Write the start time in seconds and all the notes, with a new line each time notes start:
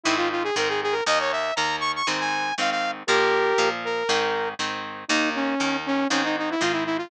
0.03 G#2 D#3 C4 E4
0.17 F4
0.31 F4
0.43 G#4
0.56 G#2 D#3 C4 A#4
0.69 G#4
0.82 G#4
0.92 A#4
1.06 D#2 D#3 A#3 D#5
1.20 C#5
1.32 E5
1.56 D#2 D#3 A#3 A#5
1.80 C#6
1.95 C#6
2.07 G#2 D#3 C4
2.20 G#5
2.58 G#2 D#3 C4 F5
2.71 F5
3.07 A#2 F3 A#3 G4 A#4
3.58 A#2 F3 A#3
3.84 A#4
4.09 G#2 D#3 C4
4.59 G#2 D#3 C4
5.08 D#2 D#3 A#3 D#4
5.35 C#4
5.60 D#2 D#3 A#3
5.86 C#4
6.10 G#2 D#3 C4 C#4
6.24 D#4
6.38 D#4
6.50 E4
6.60 G#2 D#3 C4 F4
6.72 E4
6.85 E4
6.97 F4